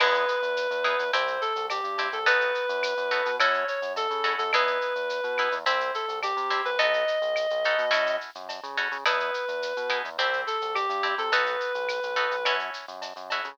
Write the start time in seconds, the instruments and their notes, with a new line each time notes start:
0.00 synth bass 1 E2, acoustic guitar (steel) B3 D#4 E4 G#4, clarinet B4, crash, cowbell, claves
0.14 shaker
0.28 shaker
0.42 synth bass 1 E2, shaker
0.57 shaker
0.71 synth bass 1 E2, shaker
0.84 acoustic guitar (steel) B3 D#4 E4 G#4, claves, shaker
0.99 synth bass 1 E2, shaker
1.13 synth bass 1 C2, acoustic guitar (steel) C4 E4 G4, clarinet C5, cowbell, shaker
1.27 shaker
1.41 clarinet A4, shaker
1.56 synth bass 1 C2, shaker
1.70 clarinet G4, cowbell, claves, shaker
1.84 synth bass 1 G2, shaker
1.98 acoustic guitar (steel) C4 E4 G4, cowbell, shaker
2.12 synth bass 1 C2, clarinet A4, shaker
2.26 synth bass 1 B1, acoustic guitar (steel) B3 D#4 F#4 A4, clarinet B4, cowbell, shaker
2.41 shaker
2.55 shaker
2.69 synth bass 1 F#2, shaker
2.83 claves, shaker
2.97 synth bass 1 F#2, shaker
3.11 acoustic guitar (steel) B3 D#4 F#4 A4, shaker
3.25 synth bass 1 B2, shaker
3.39 synth bass 1 F#2, acoustic guitar (steel) C#4 E4 F#4 A4, clarinet C#5, cowbell, claves, shaker
3.54 shaker
3.68 clarinet C#5, shaker
3.82 synth bass 1 F#2, shaker
3.96 clarinet A4, cowbell, shaker
4.10 synth bass 1 C#3, shaker
4.24 acoustic guitar (steel) C#4 E4 F#4 A4, cowbell, shaker
4.38 synth bass 1 F#2, clarinet A4, shaker
4.53 synth bass 1 E2, acoustic guitar (steel) B3 D#4 E4 G#4, clarinet B4, cowbell, claves, shaker
4.67 shaker
4.81 shaker
4.95 synth bass 1 E2, shaker
5.09 shaker
5.24 synth bass 1 B2, shaker
5.38 acoustic guitar (steel) B3 D#4 E4 G#4, claves, shaker
5.52 synth bass 1 E2, shaker
5.66 synth bass 1 C2, acoustic guitar (steel) C4 E4 G4, clarinet C5, cowbell, shaker
5.80 shaker
5.94 clarinet A4, shaker
6.08 synth bass 1 C2, shaker
6.23 clarinet G4, cowbell, claves, shaker
6.37 synth bass 1 C3, shaker
6.50 acoustic guitar (steel) C4 E4 G4, cowbell, shaker
6.65 synth bass 1 C2, clarinet B4, shaker
6.79 synth bass 1 B1, acoustic guitar (steel) B3 D#4 F#4 A4, clarinet D#5, cowbell, shaker
6.93 shaker
7.08 shaker
7.22 synth bass 1 B1, shaker
7.36 claves, shaker
7.50 synth bass 1 B1, shaker
7.64 acoustic guitar (steel) B3 D#4 F#4 A4, shaker
7.78 synth bass 1 B2, shaker
7.91 synth bass 1 F#2, acoustic guitar (steel) C#4 E4 F#4 A4, cowbell, claves, shaker
8.07 shaker
8.21 shaker
8.35 synth bass 1 F#2, shaker
8.49 cowbell, shaker
8.63 synth bass 1 C#3, shaker
8.77 acoustic guitar (steel) C#4 E4 F#4 A4, cowbell, shaker
8.92 synth bass 1 C#3, shaker
9.05 synth bass 1 E2, acoustic guitar (steel) B3 D#4 E4 G#4, clarinet B4, cowbell, claves, shaker
9.20 shaker
9.34 shaker
9.48 synth bass 1 E2, shaker
9.62 shaker
9.76 synth bass 1 B2, shaker
9.90 acoustic guitar (steel) B3 D#4 E4 G#4, claves, shaker
10.05 synth bass 1 E2, shaker
10.18 synth bass 1 C2, acoustic guitar (steel) C4 E4 G4, clarinet C5, cowbell, shaker
10.33 shaker
10.47 clarinet A4, shaker
10.61 synth bass 1 C2, shaker
10.74 clarinet G4, cowbell, claves, shaker
10.89 synth bass 1 G2, shaker
11.03 acoustic guitar (steel) C4 E4 G4, cowbell, shaker
11.18 synth bass 1 C3, clarinet A4, shaker
11.32 synth bass 1 B1, acoustic guitar (steel) B3 D#4 F#4 A4, clarinet B4, cowbell, shaker
11.46 shaker
11.60 shaker
11.75 synth bass 1 B1, shaker
11.89 claves, shaker
12.03 synth bass 1 B1, shaker
12.16 acoustic guitar (steel) B3 D#4 F#4 A4, shaker
12.31 synth bass 1 B1, shaker
12.45 synth bass 1 F#2, acoustic guitar (steel) C#4 E4 F#4 A4, cowbell, claves, shaker
12.59 shaker
12.74 shaker
12.88 synth bass 1 F#2, shaker
13.02 cowbell, shaker
13.16 synth bass 1 F#2, shaker
13.30 acoustic guitar (steel) C#4 E4 F#4 A4, cowbell, shaker
13.44 synth bass 1 C#3, shaker